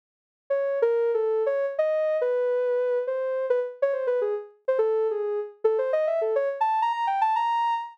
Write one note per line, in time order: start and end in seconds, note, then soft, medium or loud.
0.50 0.79 C#5 medium
0.82 1.11 A#4 loud
1.14 1.43 A4 medium
1.46 1.66 C#5 loud
1.79 2.17 D#5 medium
2.21 2.99 B4 medium
3.07 3.46 C5 medium
3.50 3.60 B4 medium
3.82 3.92 C#5 medium
3.93 4.06 C5 medium
4.07 4.20 B4 medium
4.21 4.34 G#4 medium
4.68 4.78 C5 medium
4.79 5.07 A4 loud
5.11 5.40 G#4 medium
5.64 5.77 A4 medium
5.78 5.91 C5 medium
5.93 6.06 D#5 loud
6.07 6.20 E5 medium
6.21 6.34 A4 medium
6.36 6.49 C#5 loud
6.61 6.80 A5 medium
6.82 6.92 A#5 loud
6.93 7.06 A#5 medium
7.07 7.20 G5 medium
7.21 7.34 A5 loud
7.36 7.74 A#5 loud